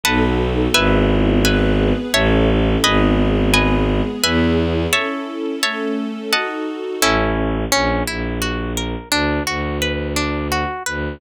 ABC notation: X:1
M:3/4
L:1/8
Q:1/4=86
K:E
V:1 name="Orchestral Harp"
[Bdfa]2 | [Beg]2 [Beg]2 [cea]2 | [Bdg]2 [Bdg]2 [Beg]2 | [cea]2 [cea]2 [dfa]2 |
[K:A] [CEA]2 C E F ^A | D F B D F B |]
V:2 name="Violin" clef=bass
B,,,2 | G,,,4 A,,,2 | G,,,4 E,,2 | z6 |
[K:A] A,,,2 ^A,,, A,,,3 | D,, D,,4 D,, |]
V:3 name="String Ensemble 1"
[B,DFA]2 | [B,EG]2 [B,GB]2 [CEA]2 | [B,DG]2 [G,B,G]2 [B,EG]2 | [CEA]2 [A,CA]2 [DFA]2 |
[K:A] z6 | z6 |]